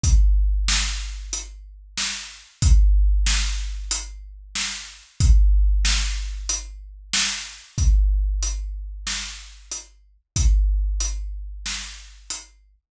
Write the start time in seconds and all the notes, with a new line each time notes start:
0.03 kick, closed hi-hat
0.68 snare
1.33 closed hi-hat
1.97 snare
2.62 kick, closed hi-hat
3.26 snare
3.91 closed hi-hat
4.55 snare
5.20 kick, closed hi-hat
5.85 snare
6.49 closed hi-hat
7.13 snare
7.78 kick, closed hi-hat
8.43 closed hi-hat
9.07 snare
9.72 closed hi-hat
10.36 kick, closed hi-hat
11.00 closed hi-hat
11.66 snare
12.30 closed hi-hat